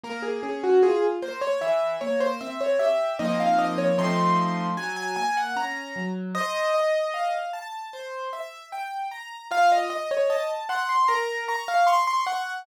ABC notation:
X:1
M:4/4
L:1/16
Q:1/4=76
K:Bbm
V:1 name="Acoustic Grand Piano"
B A A G A z c d =e2 d c e d e2 | e f e d c'4 a a a g b3 z | e6 z10 | f e e d e z g c' b2 b f c' c' g2 |]
V:2 name="Acoustic Grand Piano"
B,2 D2 F2 B,2 =E,2 B,2 C2 =G2 | [F,B,CE]4 [F,=A,CE]4 G,2 B,2 D2 G,2 | c2 e2 f2 =a2 c2 =e2 =g2 b2 | F2 e2 =a2 c'2 B2 d'2 d'2 d'2 |]